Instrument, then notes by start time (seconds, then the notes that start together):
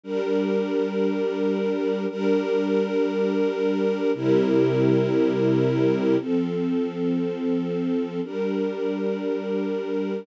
string ensemble 1
0.04 G3 D4 A#4
2.09 G3 D4 A#4
4.14 C3 G3 E4 A#4
6.18 F3 C4 A4
8.23 G3 D4 A#4